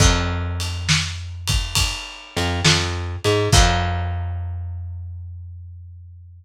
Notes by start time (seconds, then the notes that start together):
0.00 F2, kick, crash
0.60 ride
0.89 snare
1.47 kick, ride
1.75 kick, ride
2.37 F2, ride
2.65 F2, snare
3.24 G#2, ride
3.52 F2, kick, crash